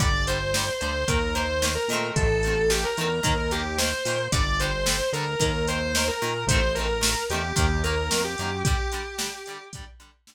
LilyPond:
<<
  \new Staff \with { instrumentName = "Distortion Guitar" } { \time 4/4 \key g \minor \tempo 4 = 111 d''8 c''4 c''8 bes'8 c''8. bes'8. | a'4 g'16 bes'4 bes'16 g'8 c''4 | d''8 c''4 bes'8 bes'8 c''8. bes'8. | c''8 bes'4 g'8 g'8 bes'8. g'8. |
g'2 r2 | }
  \new Staff \with { instrumentName = "Acoustic Guitar (steel)" } { \time 4/4 \key g \minor <d g>8 <d g>8 <d g>8 <d g>8 <ees bes>8 <ees bes>8 <ees bes>8 <ees a c'>8~ | <ees a c'>8 <ees a c'>8 <ees a c'>8 <ees a c'>8 <ees bes>8 <ees bes>8 <ees bes>8 <ees bes>8 | <d g>8 <d g>8 <d g>8 <d g>8 <ees bes>8 <ees bes>8 <ees bes>8 <ees bes>8 | <ees a c'>8 <ees a c'>8 <ees a c'>8 <ees a c'>8 <ees bes>8 <ees bes>8 <ees bes>8 <ees bes>8 |
<d g>8 <d g>8 <d g>8 <d g>8 <d g>8 <d g>8 <d g>8 r8 | }
  \new Staff \with { instrumentName = "Synth Bass 1" } { \clef bass \time 4/4 \key g \minor g,,4. d,8 ees,4. bes,8 | a,,4. e,8 ees,4. bes,8 | g,,4. d,8 ees,4. bes,8 | a,,4. e,8 ees,4 f,8 fis,8 |
r1 | }
  \new DrumStaff \with { instrumentName = "Drums" } \drummode { \time 4/4 <hh bd>8 hh8 sn8 hh8 <hh bd>8 hh8 sn8 hh8 | <hh bd>8 hh8 sn8 hh8 <hh bd>8 hh8 sn8 hho8 | <hh bd>8 hh8 sn8 hh8 <hh bd>8 hh8 sn8 hh8 | <hh bd>8 hh8 sn8 hh8 <hh bd>8 hh8 sn8 hh8 |
<hh bd>8 hh8 sn8 hh8 <hh bd>8 hh8 sn4 | }
>>